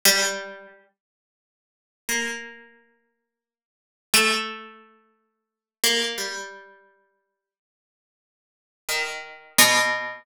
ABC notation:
X:1
M:6/8
L:1/8
Q:3/8=59
K:none
V:1 name="Harpsichord"
G,2 z4 | _B,5 z | A,5 _B, | G,4 z2 |
z2 _E,2 B,,2 |]